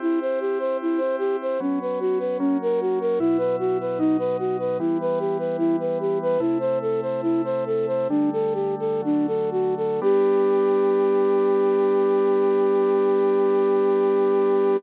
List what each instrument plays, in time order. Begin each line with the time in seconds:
0.00 drawbar organ C4 E4 G4, flute E4
0.21 flute C5
0.40 flute G4
0.59 flute C5
0.82 flute E4
0.98 flute C5
1.18 flute G4
1.41 flute C5
1.60 drawbar organ F#3 B3 C#4, flute C#4
1.81 flute B4
2.00 flute F#4
2.19 flute B4
2.39 drawbar organ F#3 A#3 C#4, flute C#4
2.62 flute A#4
2.81 flute F#4
3.01 flute A#4
3.19 drawbar organ B2 F#3 E4, flute E4
3.38 flute B4
3.59 flute F#4
3.80 flute B4
3.99 drawbar organ B2 F#3 D#4, flute D#4
4.19 flute B4
4.39 flute F#4
4.59 flute B4
4.79 drawbar organ E3 G3 B3, flute E4
5.01 flute B4
5.19 flute G4
5.38 flute B4
5.58 flute E4
5.80 flute B4
6.00 flute G4
6.22 flute B4
6.40 drawbar organ C3 A3 E4, flute E4
6.60 flute C5
6.81 flute A4
7.02 flute C5
7.22 flute E4
7.44 flute C5
7.66 flute A4
7.87 flute C5
8.09 drawbar organ D3 G3 A3, flute D4
8.32 flute A4
8.54 flute G4
8.79 flute A4
9.02 drawbar organ D3 F#3 A3, flute D4
9.27 flute A4
9.51 flute F#4
9.77 flute A4
10.02 drawbar organ G3 B3 D4, flute G4